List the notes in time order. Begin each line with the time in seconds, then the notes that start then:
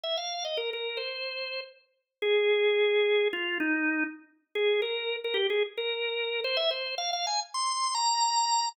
0.04 E5
0.17 F5
0.45 D#5
0.57 A#4
0.73 A#4
0.97 C5
2.22 G#4
3.33 F4
3.60 D#4
4.55 G#4
4.82 A#4
5.24 A#4
5.34 G4
5.50 G#4
5.78 A#4
6.44 C5
6.57 E5
6.71 C5
6.98 F5
7.13 F5
7.27 G#5
7.54 C6
7.95 A#5